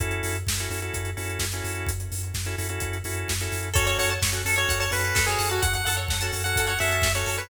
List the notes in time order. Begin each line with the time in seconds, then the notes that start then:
0.00 F#2 C#4 E4 F#4 A4, kick, closed hi-hat
0.11 closed hi-hat
0.23 F#2, open hi-hat
0.35 closed hi-hat
0.47 F#2, kick, snare
0.59 C#4 E4 F#4 A4, closed hi-hat
0.70 F#2 C#4 E4 F#4 A4, open hi-hat
0.82 C#4 E4 F#4 A4, closed hi-hat
0.94 F#2, kick, closed hi-hat
1.05 closed hi-hat
1.17 F#2 C#4 E4 F#4 A4, open hi-hat
1.29 closed hi-hat
1.39 F#2, kick, snare
1.52 C#4 E4 F#4 A4, closed hi-hat
1.64 F#2, open hi-hat
1.75 closed hi-hat
1.86 F#2, kick, closed hi-hat
2.00 closed hi-hat
2.12 F#2, open hi-hat
2.23 closed hi-hat
2.34 F#2, kick, snare
2.45 C#4 E4 F#4 A4, closed hi-hat
2.58 F#2 C#4 E4 F#4 A4, open hi-hat
2.69 C#4 E4 F#4 A4, closed hi-hat
2.80 F#2, kick, closed hi-hat
2.93 closed hi-hat
3.04 F#2 C#4 E4 F#4 A4, open hi-hat
3.17 closed hi-hat
3.28 F#2, kick, snare
3.40 C#4 E4 F#4 A4, closed hi-hat
3.52 F#2, open hi-hat
3.62 closed hi-hat
3.74 F#2 C#4 F#4 A4 C#5, kick, closed hi-hat
3.87 C#5, closed hi-hat
3.98 F#2 C#5 F#5, open hi-hat
4.10 A5, closed hi-hat
4.22 F#2 C#6, kick, snare
4.32 C#4 F#4 A4 F#6, closed hi-hat
4.45 F#2 C#4 F#4 A4, open hi-hat
4.56 C#4 F#4 A4 C#5, closed hi-hat
4.69 F#2 F#5, kick, closed hi-hat
4.80 C#5 A5, closed hi-hat
4.91 F#2 C#4 F#4 A4 B4 C#6, open hi-hat
5.04 F#6, closed hi-hat
5.15 F#2 A4, kick, snare
5.26 C#4 F#4 G#4 A4 C#5, closed hi-hat
5.39 F#2 F#5, open hi-hat
5.50 F#4 A5, closed hi-hat
5.62 F#2 F#5 C#6, kick, closed hi-hat
5.73 F#5 F#6, kick, closed hi-hat
5.85 F#2 A4 F#5, open hi-hat
5.97 C#5, closed hi-hat
6.08 F#2 F#5, kick, snare
6.21 C#4 F#4 A4 A5, closed hi-hat
6.33 F#2 C#4 F#4 A4 C#6, open hi-hat
6.44 C#4 F#4 A4 F#5 F#6, closed hi-hat
6.56 F#2 A4, kick, closed hi-hat
6.67 C#5 F#5, closed hi-hat
6.79 F#2 C#4 F#4 A4 E5 F#5, open hi-hat
6.91 A5, closed hi-hat
7.02 F#2 C#6, kick, snare
7.15 C#4 F#4 A4 C#5 F#6, closed hi-hat
7.26 F#2 A4, open hi-hat
7.38 B4 C#5, closed hi-hat